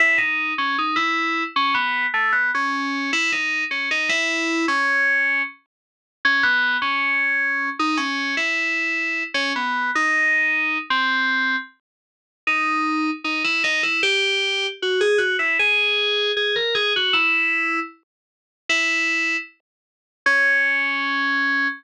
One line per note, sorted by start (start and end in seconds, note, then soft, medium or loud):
0.00 0.19 E4 medium
0.18 0.53 D#4 medium
0.58 0.77 C#4 medium
0.78 0.97 D#4 medium
0.96 1.43 E4 medium
1.56 1.75 C#4 medium
1.74 2.06 B3 medium
2.14 2.32 A3 medium
2.32 2.51 B3 medium
2.55 3.11 C#4 medium
3.13 3.31 E4 loud
3.32 3.64 D#4 medium
3.71 3.89 C#4 medium
3.91 4.09 D#4 medium
4.09 4.66 E4 medium
4.68 5.42 C#4 medium
6.25 6.43 C#4 medium
6.43 6.77 B3 medium
6.82 7.69 C#4 medium
7.79 7.98 D#4 medium
7.97 8.35 C#4 medium
8.37 9.23 E4 medium
9.34 9.53 C#4 medium
9.56 9.91 B3 medium
9.95 10.78 D#4 medium
10.90 11.56 C4 medium
12.47 13.10 D#4 loud
13.24 13.43 D#4 medium
13.44 13.63 E4 loud
13.64 13.82 D#4 medium
13.83 14.01 E4 medium
14.03 14.67 G4 loud
14.82 15.01 F#4 medium
15.01 15.19 G#4 loud
15.18 15.37 F#4 loud
15.39 15.57 E4 medium
15.59 16.32 G#4 loud
16.37 16.55 G#4 medium
16.56 16.74 A#4 medium
16.75 16.93 G#4 medium
16.96 17.14 F#4 medium
17.13 17.80 E4 loud
18.69 19.37 E4 loud
20.26 21.68 C#4 loud